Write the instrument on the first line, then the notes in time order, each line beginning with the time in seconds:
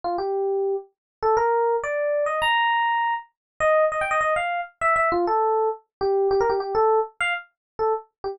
electric piano 1
0.04 F4
0.18 G4
1.23 A4
1.37 A#4
1.83 D5
2.26 D#5
2.42 A#5
3.60 D#5
3.92 D#5
4.01 G5
4.11 D#5
4.21 D#5
4.36 F5
4.81 E5
4.96 E5
5.12 F4
5.27 A4
6.01 G4
6.31 G4
6.41 A#4
6.50 G4
6.60 G4
6.75 A4
7.20 F5
7.79 A4
8.24 G4